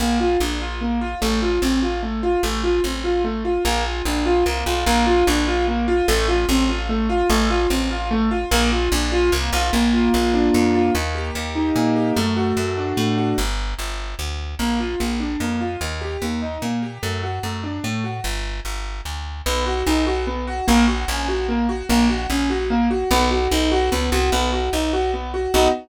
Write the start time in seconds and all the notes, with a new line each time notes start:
0.00 A#1 A#3
0.20 F4
0.40 A#1 D4
0.61 F4
0.81 A#3
1.01 F4
1.22 A1 A3
1.42 F4
1.62 A1 C4
1.82 F4
2.03 A3
2.23 F4
2.43 A1 A3
2.64 F4
2.84 A1 C4
3.04 F4
3.24 A3
3.45 F4
3.65 A#1 A#3
3.85 F4
4.05 A#1 D4
4.26 F4
4.46 C2 A#3
4.66 B1 F4
4.86 A#1 A#3
5.07 F4
5.27 A#1 D4
5.47 F4
5.68 A#3
5.88 F4
6.08 A1 A3
6.28 F4
6.49 A1 C4
6.69 F4
6.89 A3
7.09 F4
7.30 A1 A3
7.50 F4
7.70 A1 C4
7.91 F4
8.11 A3
8.31 F4
8.51 A#1 A#3
8.72 F4
8.92 A#1 D4
9.12 F4
9.32 C2 A#3
9.53 B1 F4
9.73 A#1 A#3
9.93 F4
10.14 A#1 A#3
10.34 D4
10.54 F2 A#3
10.74 F4
10.95 D#2 A#3
11.15 G4
11.35 D#2 A#3
11.55 D#4
11.76 A#2 A#3
11.96 G4
12.16 F#2 A3
12.36 F#4
12.57 F#2 A3
12.77 D4
12.97 A2 A3
13.18 F#4
13.38 G1
13.79 G1
14.19 D2
14.59 A#1 A#3
14.80 F4
15.00 A#1 A#3
15.20 D4
15.40 F2 A#3
15.61 F4
15.81 D#2 A#3
16.01 G4
16.22 D#2 A#3
16.42 D#4
16.62 A#2 A#3
16.82 G4
17.03 F#2 A3
17.23 F#4
17.43 F#2 A3
17.64 D4
17.84 A2 A3
18.04 F#4
18.24 G1
18.65 G1
19.05 D2
19.46 B1 B3
19.66 F#4
19.86 B1 D#4
20.07 F#4
20.27 B3
20.47 F#4
20.67 A#1 A#3
20.88 F#4
21.08 A#1 C#4
21.28 F#4
21.49 A#3
21.69 F#4
21.89 A#1 A#3
22.10 F#4
22.30 A#1 C#4
22.50 F#4
22.70 A#3
22.91 F#4
23.11 B1 B3
23.31 F#4
23.51 B1 D#4
23.72 F#4
23.92 C#2 B3
24.12 C2 F#4
24.32 B1 B3
24.53 F#4
24.73 B1 D#4
24.93 F#4
25.14 B3
25.34 F#4
25.54 B1 B3 D#4 F#4